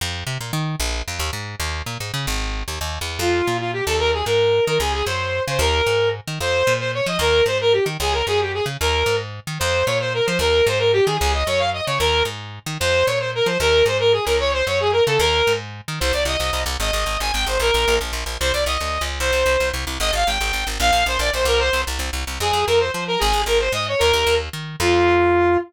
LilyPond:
<<
  \new Staff \with { instrumentName = "Lead 2 (sawtooth)" } { \time 6/8 \key f \minor \tempo 4. = 150 r2. | r2. | r2. | r2. |
f'4. f'8 g'8 a'8 | bes'8 aes'8 bes'4. bes'8 | aes'8 aes'8 c''4. c''8 | bes'2 r4 |
c''4. c''8 des''8 ees''8 | bes'4 c''8 bes'8 g'8 r8 | aes'8 bes'8 aes'8 g'8 aes'8 r8 | bes'4. r4. |
c''4 des''8 c''8 bes'8 c''8 | bes'4 c''8 bes'8 g'8 aes'8 | aes'8 ees''8 des''8 f''8 ees''8 des''8 | bes'4 r2 |
c''4 des''8 c''8 bes'8 c''8 | bes'4 c''8 bes'8 aes'8 bes'8 | des''8 c''8 des''8 aes'8 bes'8 a'8 | bes'4. r4. |
\key c \minor c''8 d''8 ees''4. r8 | ees''4. aes''8 g''8 c''8 | bes'4. r4. | c''8 d''8 ees''4. r8 |
c''2 r4 | ees''8 f''8 g''4. r8 | f''4 c''8 d''8 c''8 bes'8 | c''4 r2 |
\key f \minor aes'4 bes'8 c''8 c''8 bes'8 | aes'4 bes'8 c''8 ees''8 des''8 | bes'4. r4. | f'2. | }
  \new Staff \with { instrumentName = "Electric Bass (finger)" } { \clef bass \time 6/8 \key f \minor f,4 c8 bes,8 ees4 | bes,,4 f,8 ees,8 aes,4 | ees,4 bes,8 aes,8 des8 aes,,8~ | aes,,4 ees,8 ees,8. e,8. |
f,4 bes,4. ees,8~ | ees,4 aes,4. ees8 | des,4 ges,4. des8 | ees,4 aes,4. ees8 |
f,4 bes,4. f8 | ees,4 aes,4. ees8 | des,4 ges,4. des8 | ees,4 aes,4. ees8 |
f,4 bes,4. f8 | ees,4 aes,4. ees8 | des,4 ges,4. des8 | ees,4 aes,4. ees8 |
f,4 bes,4. f8 | ees,4 aes,4. des,8~ | des,4 ges,4. des8 | ees,4 aes,4. ees8 |
\key c \minor c,8 c,8 c,8 c,8 c,8 c,8 | aes,,8 aes,,8 aes,,8 aes,,8 aes,,8 aes,,8 | bes,,8 bes,,8 bes,,8 bes,,8 bes,,8 bes,,8 | c,8 c,8 c,8 d,8. des,8. |
c,8 c,8 c,8 c,8 c,8 c,8 | aes,,8 aes,,8 aes,,8 aes,,8 aes,,8 aes,,8 | bes,,8 bes,,8 bes,,8 bes,,8 bes,,8 c,8~ | c,8 c,8 c,8 c,8 c,8 c,8 |
\key f \minor f,8 f,8 f,4 f4 | aes,,8 aes,,8 aes,,4 aes,4 | ees,8 ees,8 ees,4 ees4 | f,2. | }
>>